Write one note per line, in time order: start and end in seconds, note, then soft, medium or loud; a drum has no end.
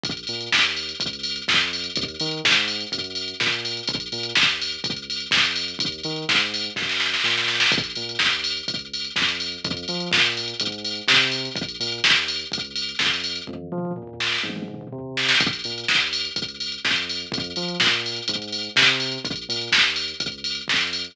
0.04 0.24 A#1 loud
0.04 kick loud
0.04 closed hi-hat loud
0.17 closed hi-hat medium
0.27 0.49 A#2 medium
0.27 open hi-hat medium
0.41 closed hi-hat medium
0.52 0.93 D#2 loud
0.52 kick medium
0.52 snare loud
0.65 closed hi-hat medium
0.77 open hi-hat medium
0.89 closed hi-hat medium
1.00 1.41 C#2 loud
1.00 kick loud
1.00 closed hi-hat loud
1.13 closed hi-hat medium
1.23 open hi-hat loud
1.36 closed hi-hat medium
1.48 1.89 F2 loud
1.48 kick loud
1.48 snare loud
1.61 closed hi-hat medium
1.73 open hi-hat medium
1.84 closed hi-hat medium
1.96 2.16 D#2 loud
1.96 kick loud
1.96 closed hi-hat loud
2.08 closed hi-hat medium
2.20 2.41 D#3 loud
2.20 open hi-hat loud
2.31 closed hi-hat medium
2.44 2.85 G#2 loud
2.44 kick loud
2.44 snare loud
2.56 closed hi-hat medium
2.68 open hi-hat loud
2.81 closed hi-hat medium
2.92 3.34 F#2 loud
2.92 kick loud
2.92 closed hi-hat loud
3.04 closed hi-hat medium
3.15 open hi-hat medium
3.28 closed hi-hat medium
3.40 3.81 A#2 medium
3.40 kick loud
3.40 snare loud
3.52 closed hi-hat medium
3.65 open hi-hat medium
3.77 closed hi-hat medium
3.88 4.08 A#1 loud
3.88 kick loud
3.88 closed hi-hat loud
4.00 closed hi-hat loud
4.12 4.33 A#2 loud
4.12 open hi-hat medium
4.23 closed hi-hat loud
4.35 4.77 D#2 medium
4.35 kick loud
4.35 snare loud
4.49 closed hi-hat medium
4.62 open hi-hat loud
4.72 closed hi-hat medium
4.84 5.26 C#2 medium
4.84 kick loud
4.84 closed hi-hat loud
4.96 closed hi-hat medium
5.10 open hi-hat loud
5.20 closed hi-hat medium
5.31 5.74 F2 medium
5.31 kick loud
5.31 snare loud
5.45 closed hi-hat loud
5.56 open hi-hat loud
5.68 closed hi-hat medium
5.79 6.01 D#2 loud
5.79 kick loud
5.79 closed hi-hat loud
5.92 closed hi-hat medium
6.04 6.25 D#3 loud
6.04 open hi-hat medium
6.16 closed hi-hat medium
6.29 6.70 G#2 medium
6.29 kick loud
6.29 snare loud
6.40 closed hi-hat medium
6.54 open hi-hat loud
6.64 closed hi-hat medium
6.76 7.17 F#2 medium
6.76 kick loud
6.76 snare medium
6.89 snare loud
7.00 snare loud
7.14 snare loud
7.24 7.65 A#2 medium
7.24 snare loud
7.38 snare loud
7.48 snare loud
7.60 snare loud
7.72 7.93 A#1 loud
7.72 kick loud
7.72 closed hi-hat loud
7.84 closed hi-hat loud
7.96 8.17 A#2 medium
7.96 open hi-hat medium
8.09 closed hi-hat medium
8.19 8.61 D#2 medium
8.19 kick medium
8.19 snare loud
8.33 closed hi-hat medium
8.44 open hi-hat loud
8.57 closed hi-hat medium
8.68 9.09 C#2 medium
8.68 kick loud
8.68 closed hi-hat loud
8.79 closed hi-hat medium
8.94 open hi-hat medium
9.05 closed hi-hat medium
9.16 9.57 F2 medium
9.16 kick loud
9.16 snare loud
9.29 closed hi-hat medium
9.40 open hi-hat medium
9.52 closed hi-hat medium
9.64 9.85 F2 loud
9.64 kick loud
9.64 closed hi-hat loud
9.77 closed hi-hat medium
9.88 10.09 F3 medium
9.88 open hi-hat medium
10.00 closed hi-hat medium
10.12 10.54 A#2 loud
10.12 kick loud
10.12 snare loud
10.26 closed hi-hat medium
10.37 open hi-hat medium
10.48 closed hi-hat medium
10.60 11.01 G#2 loud
10.60 kick medium
10.60 closed hi-hat loud
10.72 closed hi-hat medium
10.85 open hi-hat loud
10.96 closed hi-hat medium
11.08 11.49 C3 loud
11.08 kick loud
11.08 snare loud
11.21 closed hi-hat medium
11.31 open hi-hat loud
11.45 closed hi-hat medium
11.56 11.77 A#1 loud
11.56 kick loud
11.56 closed hi-hat loud
11.69 closed hi-hat medium
11.80 12.01 A#2 loud
11.80 open hi-hat loud
11.92 closed hi-hat medium
12.04 12.45 D#2 loud
12.04 kick medium
12.04 snare loud
12.16 closed hi-hat medium
12.28 open hi-hat loud
12.39 closed hi-hat medium
12.52 12.93 C#2 medium
12.52 kick loud
12.52 closed hi-hat loud
12.65 closed hi-hat medium
12.76 open hi-hat loud
12.89 closed hi-hat medium
12.99 13.40 F2 medium
12.99 kick loud
12.99 snare loud
13.14 closed hi-hat medium
13.24 open hi-hat loud
13.36 closed hi-hat medium
13.47 13.68 F2 loud
13.47 kick medium
13.47 high tom medium
13.72 13.93 F3 loud
13.72 mid tom loud
13.85 mid tom loud
13.96 14.38 A#2 medium
13.96 floor tom loud
14.07 floor tom loud
14.20 snare loud
14.32 snare medium
14.44 14.85 G#2 medium
14.44 high tom loud
14.56 high tom loud
14.68 mid tom loud
14.81 mid tom loud
14.92 15.33 C3 medium
14.92 floor tom loud
15.17 snare loud
15.29 snare loud
15.40 15.61 A#1 loud
15.40 kick loud
15.40 closed hi-hat loud
15.53 closed hi-hat loud
15.64 15.85 A#2 medium
15.64 open hi-hat medium
15.78 closed hi-hat medium
15.88 16.29 D#2 medium
15.88 kick medium
15.88 snare loud
16.00 closed hi-hat medium
16.13 open hi-hat loud
16.25 closed hi-hat medium
16.36 16.77 C#2 medium
16.36 kick loud
16.36 closed hi-hat loud
16.48 closed hi-hat medium
16.60 open hi-hat medium
16.72 closed hi-hat medium
16.84 17.25 F2 medium
16.84 kick loud
16.84 snare loud
16.96 closed hi-hat medium
17.09 open hi-hat medium
17.20 closed hi-hat medium
17.32 17.53 F2 loud
17.32 kick loud
17.32 closed hi-hat loud
17.44 closed hi-hat medium
17.56 17.77 F3 medium
17.56 open hi-hat medium
17.68 closed hi-hat medium
17.80 18.21 A#2 loud
17.80 kick loud
17.80 snare loud
17.93 closed hi-hat medium
18.06 open hi-hat medium
18.16 closed hi-hat medium
18.28 18.69 G#2 loud
18.28 kick medium
18.28 closed hi-hat loud
18.42 closed hi-hat medium
18.52 open hi-hat loud
18.63 closed hi-hat medium
18.76 19.18 C3 loud
18.76 kick loud
18.76 snare loud
18.87 closed hi-hat medium
19.00 open hi-hat loud
19.12 closed hi-hat medium
19.25 19.45 A#1 loud
19.25 kick loud
19.25 closed hi-hat loud
19.36 closed hi-hat medium
19.49 19.69 A#2 loud
19.49 open hi-hat loud
19.62 closed hi-hat medium
19.72 20.13 D#2 loud
19.72 kick medium
19.72 snare loud
19.84 closed hi-hat medium
19.96 open hi-hat loud
20.08 closed hi-hat medium
20.20 20.61 C#2 medium
20.20 kick loud
20.20 closed hi-hat loud
20.32 closed hi-hat medium
20.44 open hi-hat loud
20.55 closed hi-hat medium
20.68 21.09 F2 medium
20.68 kick loud
20.68 snare loud
20.81 closed hi-hat medium
20.93 open hi-hat loud
21.05 closed hi-hat medium